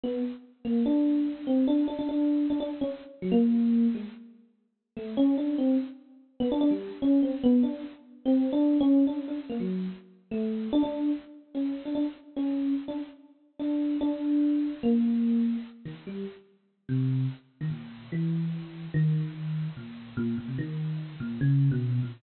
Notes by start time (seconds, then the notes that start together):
0.04 B3
0.65 A#3
0.86 D4
1.47 C4
1.67 D4
1.88 D4
1.99 D4
2.09 D4
2.50 D4
2.60 D4
2.81 C#4
3.22 F#3
3.32 A#3
3.95 G#3
4.97 A3
5.17 C#4
5.38 D4
5.58 C4
6.40 B3
6.52 D4
6.61 D4
6.71 G3
7.02 C#4
7.23 C4
7.43 B3
7.63 D4
8.26 C4
8.53 D4
8.80 C#4
9.07 D4
9.28 D4
9.50 A#3
9.60 F#3
10.31 A3
10.73 D4
10.83 D4
11.55 C#4
11.85 D4
11.95 D4
12.36 C#4
12.88 D4
13.60 D4
14.01 D4
14.83 A#3
15.85 D#3
16.07 G3
16.89 C3
17.61 D#3
17.70 A#2
18.12 E3
18.94 D#3
19.77 A#2
20.17 A#2
20.38 A#2
20.48 C3
20.58 D#3
21.20 A#2
21.41 C#3
21.71 B2
22.03 A#2